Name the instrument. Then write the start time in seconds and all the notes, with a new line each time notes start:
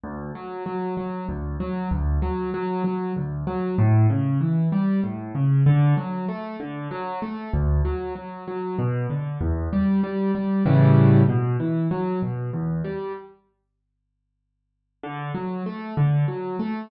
acoustic grand piano
0.04 D2
0.35 F#3
0.66 F#3
0.97 F#3
1.29 D2
1.60 F#3
1.91 D2
2.22 F#3
2.54 F#3
2.84 F#3
3.16 D2
3.47 F#3
3.78 A2
4.10 C#3
4.41 E3
4.72 G3
5.04 A2
5.35 C#3
5.66 D3
5.97 F#3
6.29 A3
6.60 D3
6.91 F#3
7.22 A3
7.54 D2
7.85 F#3
8.15 F#3
8.48 F#3
8.79 B2
9.10 D3
9.41 E2
9.73 G3
10.04 G3
10.35 G3
10.65 A2 C#3 E3 G3
11.29 B2
11.60 E3
11.91 F#3
12.22 B2
12.53 E2
12.84 G3
15.03 D3
15.35 F#3
15.66 A3
15.97 D3
16.28 F#3
16.59 A3